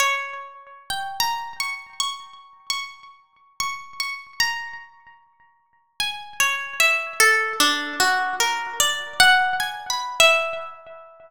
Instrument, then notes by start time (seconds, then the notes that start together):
orchestral harp
0.00 C#5
0.90 G5
1.20 A#5
1.60 C#6
2.00 C#6
2.70 C#6
3.60 C#6
4.00 C#6
4.40 A#5
6.00 G#5
6.40 C#5
6.80 E5
7.20 A4
7.60 D4
8.00 F#4
8.40 A#4
8.80 D5
9.20 F#5
9.60 G#5
9.90 B5
10.20 E5